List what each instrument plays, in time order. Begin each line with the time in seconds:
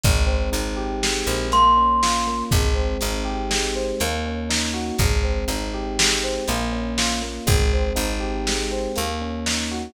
0.04 electric bass (finger) G#1, electric piano 1 G#3, kick, closed hi-hat
0.26 electric piano 1 C4
0.52 electric bass (finger) G#1, electric piano 1 D#4, closed hi-hat
0.76 electric piano 1 G4
1.03 electric piano 1 G#3, snare
1.26 electric bass (finger) A#1, electric piano 1 C4
1.52 electric piano 1 A#3, glockenspiel C6, closed hi-hat
1.77 electric piano 1 C#4
2.03 electric piano 1 F4, snare
2.27 electric piano 1 A#3
2.51 electric bass (finger) G#1, electric piano 1 G#3, kick, closed hi-hat
2.74 electric piano 1 C4
3.01 electric bass (finger) G#1, electric piano 1 D#4, closed hi-hat
3.25 electric piano 1 G4
3.50 electric piano 1 G#3, snare
3.75 electric piano 1 C4
4.00 electric bass (finger) D#2, electric piano 1 A#3, closed hi-hat
4.26 electric piano 1 C#4
4.49 electric piano 1 D#4, snare
4.74 electric piano 1 F#4
4.98 electric bass (finger) G#1, electric piano 1 G#3, kick, closed hi-hat
5.23 electric piano 1 C4
5.48 electric bass (finger) G#1, electric piano 1 D#4, closed hi-hat
5.74 electric piano 1 G4
5.99 electric piano 1 G#3, snare
6.23 electric piano 1 C4
6.48 electric bass (finger) A#1, electric piano 1 A#3, closed hi-hat
6.72 electric piano 1 C#4
6.98 electric piano 1 F4, snare
7.22 electric piano 1 A#3
7.46 electric bass (finger) G#1, electric piano 1 G#3, kick, closed hi-hat
7.73 electric piano 1 C4
7.95 electric bass (finger) G#1, electric piano 1 D#4, closed hi-hat
8.20 electric piano 1 G4
8.47 electric piano 1 G#3, snare
8.71 electric piano 1 C4
8.96 electric bass (finger) D#2, electric piano 1 A#3, closed hi-hat
9.21 electric piano 1 C#4
9.46 electric piano 1 D#4, snare
9.71 electric piano 1 F#4